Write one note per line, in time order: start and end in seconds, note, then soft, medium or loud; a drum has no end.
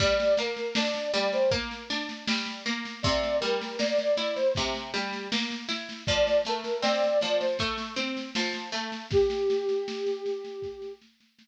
0.00 0.34 G3 loud
0.00 0.34 D5 loud
0.00 kick loud
0.00 snare medium
0.00 crash loud
0.20 snare medium
0.37 0.73 A#3 medium
0.37 0.76 A#4 medium
0.37 snare medium
0.56 snare medium
0.75 1.10 D4 medium
0.75 1.08 D5 medium
0.75 snare loud
0.94 snare medium
1.13 1.48 G3 medium
1.13 1.31 D5 loud
1.13 snare loud
1.33 1.51 C5 loud
1.33 snare medium
1.51 1.86 A#3 medium
1.51 kick loud
1.51 snare medium
1.71 snare medium
1.90 2.24 D4 medium
1.90 snare loud
2.09 snare medium
2.28 2.62 G3 medium
2.28 snare loud
2.46 snare medium
2.66 3.00 A#3 medium
2.66 snare medium
2.85 snare medium
3.03 3.38 C3 loud
3.03 3.36 D5 loud
3.03 kick loud
3.03 snare medium
3.23 snare medium
3.41 3.76 G3 medium
3.41 3.77 A#4 loud
3.41 snare medium
3.61 snare medium
3.79 4.13 A#3 medium
3.79 4.15 D5 loud
3.79 snare loud
3.98 snare medium
4.17 4.52 E4 medium
4.17 4.35 D5 medium
4.17 snare medium
4.36 4.54 C5 loud
4.36 snare medium
4.55 4.91 C3 medium
4.55 kick loud
4.55 snare medium
4.74 snare medium
4.94 5.28 G3 medium
4.94 snare loud
5.13 snare medium
5.32 5.66 A#3 medium
5.32 snare loud
5.51 snare medium
5.68 6.03 E4 medium
5.68 snare loud
5.89 snare medium
6.07 6.42 F3 medium
6.07 6.39 D5 loud
6.07 kick loud
6.07 snare medium
6.27 snare medium
6.45 6.80 A3 medium
6.45 6.80 A#4 medium
6.45 snare medium
6.64 snare medium
6.82 7.16 C4 medium
6.82 7.18 D5 loud
6.82 snare loud
7.03 snare medium
7.21 7.56 F3 medium
7.21 7.39 D5 medium
7.21 snare medium
7.40 7.58 C5 medium
7.40 snare medium
7.59 7.94 A3 medium
7.59 kick medium
7.59 snare medium
7.78 snare medium
7.96 8.30 C4 medium
7.96 snare medium
8.17 snare medium
8.35 8.70 F3 medium
8.35 snare loud
8.54 snare medium
8.72 9.06 A3 medium
8.72 snare medium
8.92 snare medium
9.11 10.93 G4 loud
9.11 kick loud
9.11 snare loud
9.30 snare medium
9.50 snare medium
9.69 snare medium
9.88 snare loud
10.06 snare medium
10.26 snare medium
10.44 snare medium
10.62 kick loud
10.62 snare medium
10.82 snare medium
11.01 snare medium
11.20 snare medium
11.39 snare loud